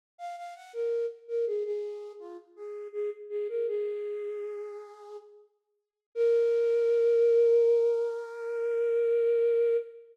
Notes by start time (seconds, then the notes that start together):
0.18 F5
0.37 F5
0.55 F#5
0.73 A#4
1.28 A#4
1.46 G#4
1.65 G#4
2.20 F4
2.56 G#4
2.93 G#4
3.30 G#4
3.49 A#4
3.68 G#4
6.15 A#4